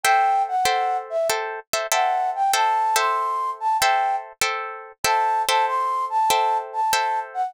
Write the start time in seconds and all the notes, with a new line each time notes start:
0.04 A4 C5 E5 G5
0.48 F#5
0.65 A4 C5 E5 G5
1.10 E5
1.30 A4 C5 E5 G5
1.73 A4 C5 E5 G5
1.92 A4 C5 E5 F#5 G5
2.35 G5
2.54 A4 C5 E5 G5 A5
2.96 A4 C5 E5 G5 C6
3.60 A5
3.79 A4 C5 E5 G5
4.42 A4 C5 E5 G5
5.04 A4 C5 E5 G5 A5
5.48 A4 C5 E5 G5 A5
5.67 C6
6.10 A5
6.30 A4 C5 E5 G5
6.73 A5
6.93 A4 C5 E5 G5
7.34 F#5